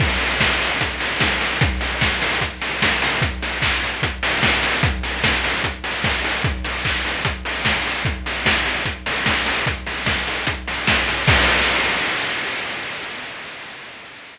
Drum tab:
CC |x-------|--------|--------|--------|
HH |-o-oxo-o|xo-oxo-o|xo-oxo-o|xo-oxo-o|
CP |--------|--------|--x-----|--------|
SD |--o---oo|--o---oo|------oo|--o---oo|
BD |o-o-o-o-|o-o-o-o-|o-o-o-o-|o-o-o-o-|

CC |--------|--------|--------|x-------|
HH |xo-oxo-o|xo-oxo-o|xo-oxo-o|--------|
CP |--x-----|--------|--------|--------|
SD |------oo|--o---oo|--o---oo|--------|
BD |o-o-o-o-|o-o-o-o-|o-o-o-o-|o-------|